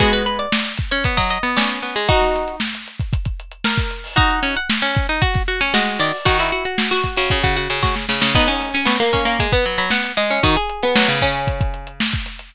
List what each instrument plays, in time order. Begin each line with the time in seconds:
0.00 pizzicato strings G#3 B3 F#4 G#4, kick, closed hi-hat
0.12 pizzicato strings B4, closed hi-hat
0.26 pizzicato strings B4, closed hi-hat
0.39 pizzicato strings D5, closed hi-hat
0.52 snare
0.65 closed hi-hat
0.77 kick, closed hi-hat
0.91 pizzicato strings C#4 C#5, closed hi-hat
1.04 pizzicato strings B3, kick, closed hi-hat
1.17 pizzicato strings F#3 D#5, kick, closed hi-hat
1.30 pizzicato strings D#5, closed hi-hat
1.43 pizzicato strings B3, closed hi-hat
1.57 pizzicato strings C#4 D5, snare
1.70 closed hi-hat
1.82 pizzicato strings B3, snare, closed hi-hat
1.96 pizzicato strings G#3, closed hi-hat
2.08 pizzicato strings D#4 F#4, kick, closed hi-hat
2.21 snare, closed hi-hat
2.35 snare, closed hi-hat
2.48 closed hi-hat
2.60 snare
2.74 snare, closed hi-hat
2.87 closed hi-hat
3.00 kick, closed hi-hat
3.13 kick, closed hi-hat
3.25 kick, closed hi-hat
3.40 closed hi-hat
3.51 closed hi-hat
3.64 pizzicato strings A#4, snare
3.78 kick, closed hi-hat
3.91 closed hi-hat
4.04 open hi-hat
4.16 pizzicato strings D#4 F#4 D#5, kick, closed hi-hat
4.31 closed hi-hat
4.43 pizzicato strings C#4, closed hi-hat
4.56 pizzicato strings F#5, closed hi-hat
4.69 pizzicato strings B5, snare
4.82 pizzicato strings C#4, closed hi-hat
4.95 kick, closed hi-hat
5.09 pizzicato strings D#4, closed hi-hat
5.22 pizzicato strings F#4, kick, closed hi-hat
5.34 kick, snare, closed hi-hat
5.48 pizzicato strings F#4, closed hi-hat
5.60 pizzicato strings C#4 G#5, snare, closed hi-hat
5.74 pizzicato strings G#3 F#4 D#5, snare
5.87 closed hi-hat
5.99 pizzicato strings D#3 D5, closed hi-hat
6.13 open hi-hat
6.25 pizzicato strings D#3 F#4, kick, closed hi-hat
6.39 pizzicato strings E4 F#4, closed hi-hat
6.52 pizzicato strings F#4, closed hi-hat
6.65 pizzicato strings F#4, closed hi-hat
6.78 snare
6.91 pizzicato strings F#4
7.03 kick, snare, closed hi-hat
7.17 pizzicato strings C#3 F#4, closed hi-hat
7.30 pizzicato strings C#3, kick, closed hi-hat
7.43 pizzicato strings C#3 F#4, kick, closed hi-hat
7.57 pizzicato strings F#4, closed hi-hat
7.70 pizzicato strings C#3, closed hi-hat
7.83 pizzicato strings F#4, kick, snare
7.96 snare
8.09 pizzicato strings C#3, snare
8.22 pizzicato strings C#3, snare
8.35 pizzicato strings B3 D#4 F#5, kick, crash
8.48 pizzicato strings C#4, closed hi-hat
8.60 snare, closed hi-hat
8.74 pizzicato strings C#4 G#5, closed hi-hat
8.85 pizzicato strings B3 C#6, snare
9.00 pizzicato strings A#3, closed hi-hat
9.13 pizzicato strings C#4, kick, snare, closed hi-hat
9.25 pizzicato strings A#3, closed hi-hat
9.39 pizzicato strings G#3, kick, closed hi-hat
9.52 pizzicato strings B3, kick, closed hi-hat
9.66 pizzicato strings F#3, closed hi-hat
9.78 pizzicato strings F#3 B5, closed hi-hat
9.90 pizzicato strings B3 F#5, snare
10.04 closed hi-hat
10.17 pizzicato strings G#3 D#5, snare, closed hi-hat
10.30 pizzicato strings C#4, closed hi-hat
10.43 pizzicato strings D#3 D#4 F#4, kick, closed hi-hat
10.57 pizzicato strings G#4, closed hi-hat
10.69 closed hi-hat
10.83 pizzicato strings B3, closed hi-hat
10.96 pizzicato strings F#3, snare
11.08 pizzicato strings C#3, closed hi-hat
11.22 pizzicato strings C#4, kick, closed hi-hat
11.36 closed hi-hat
11.47 kick, closed hi-hat
11.61 kick, closed hi-hat
11.74 closed hi-hat
11.87 closed hi-hat
12.00 snare
12.13 kick, closed hi-hat
12.26 snare, closed hi-hat
12.39 closed hi-hat